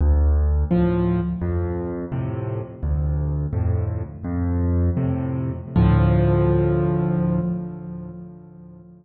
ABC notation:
X:1
M:6/8
L:1/8
Q:3/8=85
K:Dm
V:1 name="Acoustic Grand Piano" clef=bass
D,,3 [A,,F,]3 | F,,3 [A,,C,]3 | D,,3 [F,,A,,]3 | "^rit." F,,3 [A,,C,]3 |
[D,,A,,F,]6 |]